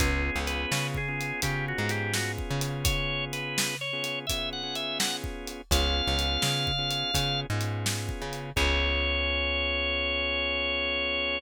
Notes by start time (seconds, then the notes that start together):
0.00 C#2 B3 C#4 F4 G#4, kick, closed hi-hat
0.36 C#2
0.47 B4, closed hi-hat
0.72 C#3, snare
0.94 G#4, kick
1.08 B3 C#4 F4 G#4
1.21 closed hi-hat
1.42 C#3 B3 C#4 F4 G4 G#4, kick, closed hi-hat
1.68 F#4
1.78 G#2 B3 C#4 F4 G#4
1.89 G4, closed hi-hat
2.14 F#4, snare
2.39 kick
2.50 C#3
2.61 closed hi-hat
2.85 C#5, kick, closed hi-hat
3.33 B4, closed hi-hat
3.58 snare
3.81 C#5
3.93 B3 C#4 F4 G#4
4.04 closed hi-hat
4.27 B3 C#4 F4 G#4 E5, kick, closed hi-hat
4.53 F#5
4.63 B3 C#4 F4 G#4
4.75 E5, closed hi-hat
4.99 F#5, snare
5.24 kick
5.47 closed hi-hat
5.71 C#2 B3 C#4 F4 G#4 F5, kick, closed hi-hat
6.07 C#2
6.19 closed hi-hat
6.42 C#3, snare
6.67 kick
6.78 B3 C#4 F4 G#4
6.91 closed hi-hat
7.14 C#3 B3 C#4 F4 G#4, kick, closed hi-hat
7.50 G#2 B3 C#4 F4 G#4
7.61 closed hi-hat
7.86 snare
8.09 kick
8.22 C#3
8.33 closed hi-hat
8.56 C#2 B3 C#4 F4 G#4 C#5, kick, crash